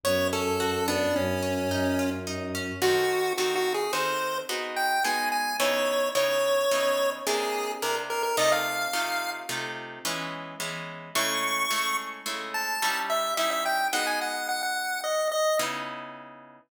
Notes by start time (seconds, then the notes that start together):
0.04 F#2 B3 C#5
0.33 C#4 A4
0.60 F#4
0.88 B3 D4
1.16 F#2 C#4
1.43 C#4
1.70 F#2 D#4
1.99 F4
2.27 D#4
2.55 C#4
2.82 D#3 C4 F#4 A4
3.38 D#3 C4 F#4 A4
3.56 F#4
3.74 G#4
3.93 D#3 C4 F#4 A4 C5
4.49 G#3 B3 D#4 F#4
4.77 G5
5.04 G#3 B3 D#4 F#4 G#5
5.32 G#5
5.60 C#3 B3 D#4 E4 C#5
6.15 C#3 B3 D#4 E4 C#5
6.71 C#3 B3 D#4 E4
7.27 C3 A#3 D4 E4 G#4
7.82 C3 A#3 D4 E4 A#4
8.10 A#4
8.23 A#4
8.37 C3 A3 D#4 F4 D#5
8.52 F5
8.93 C3 A3 D#4 F4
9.49 C3 A3 D#4 F4
10.05 E3 G#3 B3 C#4
10.60 E3 G#3 B3 C#4
11.15 C#3 G#3 A3 E4 C#6
11.71 C#3 G#3 A3 E4
12.26 C#3 G#3 A3 E4
12.54 A5
12.82 G3 C#4 D#4 E4
13.10 E5
13.37 G3 C#4 D#4 E4 E5
13.51 E5
13.66 G5
13.93 G#3 B3 D#4 F#4 F#5
14.07 G#5
14.21 F#5
14.49 F#5
14.63 F#5
15.04 D#5
15.32 D#5
15.59 C#3 B3 D#4 E4